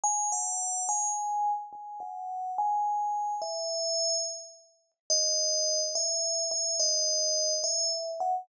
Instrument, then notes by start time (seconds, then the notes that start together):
tubular bells
0.04 G#5
0.32 F#5
0.89 G#5
1.73 G#5
2.00 F#5
2.58 G#5
3.42 E5
5.10 D#5
5.95 E5
6.51 E5
6.80 D#5
7.64 E5
8.20 F#5